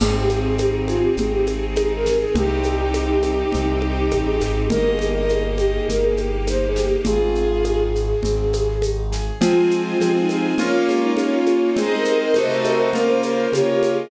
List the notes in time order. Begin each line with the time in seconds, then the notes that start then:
0.00 G#1 C4 D#4 G#4, crash, low conga, shaker
0.21 G4
0.29 G#4, high conga, shaker
0.39 C4 G#4
0.58 D#4 G4, high conga, shaker
0.79 C4
0.88 F4 G#4, high conga, shaker
1.02 G4
1.17 G#1 C4 G#4, low conga, shaker
1.33 G4
1.46 G#4, high conga, shaker
1.75 D#4 G#4, high conga, shaker
1.96 A#4
2.06 G#4, snare, high conga, shaker
2.18 G#4
2.35 C2 C4 D#4 G4, low conga, shaker
2.63 G4, high conga, shaker
2.75 G4
2.94 D#4, high conga, shaker
3.13 G4
3.23 G4, high conga, shaker
3.52 C2 C4, low conga, shaker
3.82 G4, high conga
4.11 A1 D#4, high conga, shaker
4.25 G#4
4.40 G#1 G4, snare, high conga, shaker
4.69 G1 A#3 D#4 G4 A#4 D#5, low conga, shaker
4.91 G#4
4.99 G4, high conga, shaker
5.11 A#4 D#5
5.29 D#4 G#4, high conga, shaker
5.50 D#5
5.58 G4, high conga, shaker
5.73 G#4
5.88 G1 A#3 A#4, low conga, shaker
6.03 G#4
6.17 G4, high conga, shaker
6.47 D#4 C5, high conga, shaker
6.67 G#4
6.76 G4, snare, shaker
6.86 G4
7.05 G#1 C4 F4 G#4, low conga, shaker
7.35 G#4, shaker
7.64 D#4, high conga, shaker
7.94 G#4, shaker
8.23 G#1 C4, low conga, shaker
8.53 G#4, high conga, shaker
8.82 D#4, high conga, shaker
9.12 G#4, snare, shaker
9.41 F3 G#3 C4 F4 G#4 C5 G#5, low conga, shaker
9.71 shaker
9.81 F4
10.00 F3 C4 G#4, high conga, shaker
10.20 D#4
10.29 high conga, shaker
10.58 A#3 C#4 F4 C#5, low conga, shaker
10.87 G#3, high conga, shaker
11.03 D#4
11.16 A#3 C#4 F4, high conga, shaker
11.33 F4
11.46 high conga, shaker
11.61 D#4
11.76 G#3 C4 D#4 G#4 C5 D#5, low conga, shaker
11.97 A#4
12.05 high conga, shaker
12.16 A#4
12.34 C3 A3 C4 D#4 F#4 A4 C5 D#5, high conga, shaker
12.50 C5
12.64 A#4, high conga, shaker
12.80 C5
12.93 C#3 A#3 C#4 F4 A#4, low conga, shaker
13.07 C5
13.23 A#4 C5, high conga, shaker
13.52 C#3 A#3 F4 G4 C#5, high conga, shaker
13.72 G4
13.83 high conga, shaker
13.93 G#4
13.97 D#5